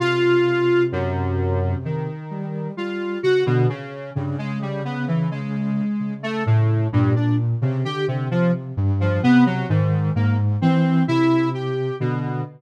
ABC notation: X:1
M:9/8
L:1/16
Q:3/8=43
K:none
V:1 name="Lead 1 (square)"
F4 _G,,4 _E,4 F2 _G B,, _D,2 | G,, _A, G, B, E, A,4 =A, A,,2 G,, D z _D, G C, | F, z2 F, B, _G, _A,,2 _B, z C2 E2 =G2 =B,,2 |]
V:2 name="Ocarina" clef=bass
C,10 G,2 G,2 _D, =D, z2 | _D,8 D,4 _B,,3 C, =D,2 | C,2 G,,2 C,2 _E,2 _A,,2 =E,2 C,4 D,2 |]